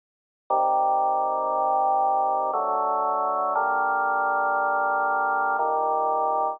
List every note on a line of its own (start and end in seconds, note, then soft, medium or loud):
0.50 2.51 C3 loud
0.50 2.51 D#3 medium
0.50 2.51 G3 medium
2.53 3.54 D3 medium
2.53 3.54 F#3 medium
2.53 3.54 A3 medium
3.56 5.57 D3 medium
3.56 5.57 G3 medium
3.56 5.57 A#3 medium
5.59 6.60 A#2 medium
5.59 6.60 D#3 medium
5.59 6.60 G3 medium